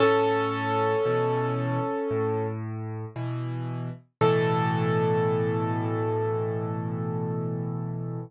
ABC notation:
X:1
M:4/4
L:1/8
Q:1/4=57
K:A
V:1 name="Acoustic Grand Piano"
[CA]5 z3 | A8 |]
V:2 name="Acoustic Grand Piano" clef=bass
A,,2 [B,,E,]2 A,,2 [B,,E,]2 | [A,,B,,E,]8 |]